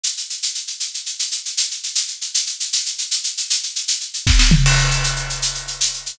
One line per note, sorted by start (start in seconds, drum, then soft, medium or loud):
0.04 shaker medium
0.17 shaker medium
0.30 shaker medium
0.43 shaker medium
0.55 shaker medium
0.67 shaker medium
0.80 shaker medium
0.94 shaker medium
1.06 shaker medium
1.19 shaker medium
1.31 shaker medium
1.45 shaker medium
1.57 shaker medium
1.71 shaker medium
1.83 shaker medium
1.95 shaker medium
2.08 shaker medium
2.21 shaker medium
2.34 shaker medium
2.47 shaker medium
2.60 shaker medium
2.73 shaker medium
2.86 shaker medium
2.98 shaker medium
3.11 shaker medium
3.24 shaker medium
3.37 shaker medium
3.50 shaker medium
3.63 shaker medium
3.76 shaker medium
3.88 shaker medium
4.00 shaker medium
4.14 shaker medium
4.27 kick medium
4.27 snare medium
4.39 snare medium
4.51 floor tom medium
4.66 crash medium
4.78 shaker medium
4.91 shaker medium
5.04 shaker medium
5.16 shaker medium
5.30 shaker medium
5.42 shaker medium
5.55 shaker medium
5.68 shaker medium
5.81 shaker medium
5.94 shaker soft
6.06 shaker medium